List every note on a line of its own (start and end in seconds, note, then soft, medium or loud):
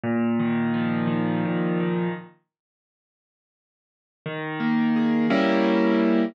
0.04 1.45 A#2 loud
0.39 1.07 D#3 medium
0.74 2.07 F3 medium
1.07 1.80 D#3 medium
1.45 2.12 A#2 loud
1.80 2.13 D#3 medium
4.26 5.26 D#3 loud
4.60 5.27 A#3 medium
4.96 5.29 G#4 medium
5.30 6.25 G3 loud
5.30 6.25 A#3 loud
5.30 6.25 C#4 loud
5.30 6.25 E4 loud